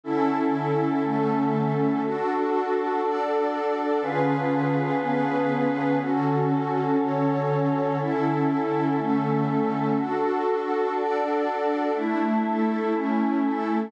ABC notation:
X:1
M:4/4
L:1/8
Q:1/4=121
K:D
V:1 name="Choir Aahs"
[D,CEA]8 | [DFA]8 | [D,C^E^GB]8 | [D,CFA]8 |
[D,CEA]8 | [DFA]8 | [A,DE]4 [A,CE]4 |]
V:2 name="Pad 2 (warm)"
[D,CEA]4 [D,A,CA]4 | [DFA]4 [DAd]4 | [D,C^E^GB]4 [D,B,CGB]4 | [D,CFA]4 [D,CAc]4 |
[D,CEA]4 [D,A,CA]4 | [DFA]4 [DAd]4 | [A,DE]2 [A,EA]2 [A,CE]2 [A,EA]2 |]